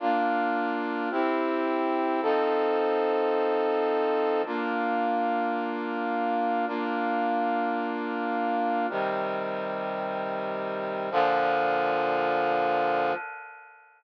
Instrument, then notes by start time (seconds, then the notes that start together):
brass section
0.00 A#3 D4 F4
1.11 C4 E4 G4
2.22 F3 C4 D#4 A4
4.45 A#3 D4 F4
6.67 A#3 D4 F4
8.90 C3 D#3 G3
11.11 A#2 D3 F3